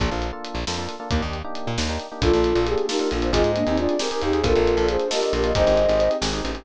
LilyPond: <<
  \new Staff \with { instrumentName = "Flute" } { \time 5/8 \key bes \mixolydian \tempo 4 = 135 r2 r8 | r2 r8 | <f' a'>4 aes'8 <ees' g'>8 <d' f'>8 | <f' aes'>8 <bes d'>16 <c' ees'>16 <d' f'>8 r8 <ees' g'>8 |
<f' a'>4 aes'8 <g' bes'>8 <g' bes'>8 | <c'' ees''>4. r4 | }
  \new Staff \with { instrumentName = "Flute" } { \time 5/8 \key bes \mixolydian r2 r8 | r2 r8 | f'4 g'8 bes'16 bes'16 r16 c''16 | ees''4 d''8 bes'16 bes'16 r16 aes'16 |
bes'4 c''8 ees''16 ees''16 r16 ees''16 | ees''4. r4 | }
  \new Staff \with { instrumentName = "Electric Piano 1" } { \time 5/8 \key bes \mixolydian <bes d' f' a'>8. <bes d' f' a'>8. <bes d' f' a'>16 <bes d' f' a'>8 <bes d' f' a'>16 | <bes d' ees' g'>8. <bes d' ees' g'>8. <bes d' ees' g'>16 <bes d' ees' g'>8 <bes d' ees' g'>16 | <bes d' f' a'>8. <bes d' f' a'>8. <bes d' f' a'>16 <bes d' f' a'>8 <bes d' f' a'>16 | <c' ees' g' aes'>8. <c' ees' g' aes'>8. <c' ees' g' aes'>16 <c' ees' g' aes'>8 <c' ees' g' aes'>16 |
<bes d' f' a'>8. <bes d' f' a'>8. <bes d' f' a'>16 <bes d' f' a'>8 <bes d' f' a'>16 | <c' ees' g' aes'>8. <c' ees' g' aes'>8. <c' ees' g' aes'>16 <c' ees' g' aes'>8 <c' ees' g' aes'>16 | }
  \new Staff \with { instrumentName = "Electric Bass (finger)" } { \clef bass \time 5/8 \key bes \mixolydian bes,,16 bes,,4 bes,,16 f,4 | ees,16 ees,4 bes,16 ees,4 | bes,,16 bes,,8 bes,,4~ bes,,16 bes,,8 | aes,,16 aes,8 ees,4~ ees,16 ees,8 |
bes,,16 bes,,8 bes,,4~ bes,,16 bes,,8 | aes,,16 aes,,8 aes,,8. aes,,8 a,,8 | }
  \new Staff \with { instrumentName = "Pad 2 (warm)" } { \time 5/8 \key bes \mixolydian r2 r8 | r2 r8 | <bes d' f' a'>2~ <bes d' f' a'>8 | <c' ees' g' aes'>2~ <c' ees' g' aes'>8 |
<bes d' f' a'>2~ <bes d' f' a'>8 | <c' ees' g' aes'>2~ <c' ees' g' aes'>8 | }
  \new DrumStaff \with { instrumentName = "Drums" } \drummode { \time 5/8 <hh bd>8 hh8 hh8 sn8 hh8 | <hh bd>8 hh8 hh8 sn8 hh8 | <hh bd>16 hh16 hh16 hh16 hh16 hh16 sn16 hh16 hh16 hh16 | <hh bd>16 hh16 hh16 hh16 hh16 hh16 sn16 hh16 hh16 hh16 |
<hh bd>16 hh16 hh16 hh16 hh16 hh16 sn16 hh16 hh16 hh16 | <hh bd>16 hh16 hh16 hh16 hh16 hh16 sn16 hh16 hh16 hh16 | }
>>